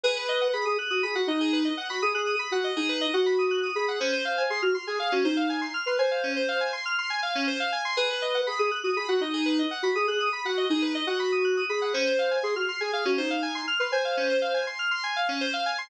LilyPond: <<
  \new Staff \with { instrumentName = "Ocarina" } { \time 4/4 \key gis \minor \tempo 4 = 121 b'4 gis'16 gis'16 r16 fis'16 gis'16 fis'16 dis'4 r16 fis'16 | gis'16 gis'8 r16 fis'8 dis'8. fis'4~ fis'16 gis'8 | bis'4 gis'16 fis'16 r16 gis'16 gis'16 fis'16 dis'4 r16 b'16 | bis'4. r2 r8 |
b'4 gis'16 gis'16 r16 fis'16 gis'16 fis'16 dis'4 r16 fis'16 | gis'16 gis'8 r16 fis'8 dis'8. fis'4~ fis'16 gis'8 | bis'4 gis'16 fis'16 r16 gis'16 gis'16 fis'16 dis'4 r16 b'16 | bis'4. r2 r8 | }
  \new Staff \with { instrumentName = "Electric Piano 2" } { \time 4/4 \key gis \minor gis'16 b'16 dis''16 fis''16 b''16 dis'''16 fis'''16 dis'''16 b''16 fis''16 dis''16 gis'16 b'16 dis''16 fis''16 b''16 | dis'''16 fis'''16 dis'''16 b''16 fis''16 dis''16 gis'16 b'16 dis''16 fis''16 b''16 dis'''16 fis'''16 dis'''16 b''16 fis''16 | cis'16 bis'16 eis''16 gis''16 bis''16 eis'''16 bis''16 gis''16 eis''16 cis'16 bis'16 eis''16 gis''16 bis''16 eis'''16 bis''16 | gis''16 eis''16 cis'16 bis'16 eis''16 gis''16 bis''16 eis'''16 bis''16 gis''16 eis''16 cis'16 bis'16 eis''16 gis''16 bis''16 |
gis'16 b'16 dis''16 fis''16 b''16 dis'''16 fis'''16 dis'''16 b''16 fis''16 dis''16 gis'16 b'16 dis''16 fis''16 b''16 | dis'''16 fis'''16 dis'''16 b''16 fis''16 dis''16 gis'16 b'16 dis''16 fis''16 b''16 dis'''16 fis'''16 dis'''16 b''16 fis''16 | cis'16 bis'16 eis''16 gis''16 bis''16 eis'''16 bis''16 gis''16 eis''16 cis'16 bis'16 eis''16 gis''16 bis''16 eis'''16 bis''16 | gis''16 eis''16 cis'16 bis'16 eis''16 gis''16 bis''16 eis'''16 bis''16 gis''16 eis''16 cis'16 bis'16 eis''16 gis''16 bis''16 | }
>>